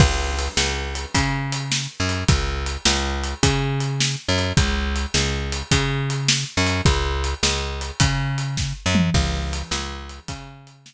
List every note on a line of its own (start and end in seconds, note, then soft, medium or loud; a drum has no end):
0.00 0.48 C#2 medium
0.00 kick loud
0.00 crash loud
0.39 closed hi-hat medium
0.57 1.06 C#2 medium
0.57 snare loud
0.95 closed hi-hat medium
1.14 1.87 C#3 medium
1.14 kick medium
1.14 closed hi-hat medium
1.52 closed hi-hat medium
1.72 snare medium
2.00 2.24 F#2 medium
2.09 closed hi-hat medium
2.28 2.77 C#2 medium
2.28 kick loud
2.28 closed hi-hat medium
2.66 closed hi-hat medium
2.85 3.34 C#2 medium
2.85 snare loud
3.24 closed hi-hat medium
3.43 4.16 C#3 medium
3.43 kick medium
3.43 closed hi-hat loud
3.80 closed hi-hat medium
4.00 snare loud
4.28 4.53 F#2 medium
4.38 closed hi-hat medium
4.57 5.06 C#2 medium
4.57 kick loud
4.57 closed hi-hat medium
4.96 closed hi-hat medium
5.14 5.63 C#2 medium
5.14 snare loud
5.52 closed hi-hat medium
5.71 6.45 C#3 medium
5.71 kick medium
5.71 closed hi-hat medium
6.10 closed hi-hat medium
6.28 snare loud
6.57 6.81 F#2 medium
6.67 closed hi-hat medium
6.85 7.34 C#2 medium
6.85 kick loud
6.85 closed hi-hat medium
7.24 closed hi-hat medium
7.43 7.91 C#2 medium
7.43 snare loud
7.81 closed hi-hat medium
8.00 8.73 C#3 medium
8.00 kick medium
8.00 closed hi-hat loud
8.38 closed hi-hat medium
8.57 kick medium
8.57 snare medium
8.86 9.10 F#2 medium
8.95 mid tom medium
9.14 9.63 C#2 medium
9.14 kick medium
9.14 crash medium
9.53 closed hi-hat medium
9.71 10.20 C#2 medium
9.71 snare loud
10.09 closed hi-hat medium
10.28 10.94 C#3 medium
10.28 kick medium
10.28 closed hi-hat medium
10.67 closed hi-hat medium
10.86 snare loud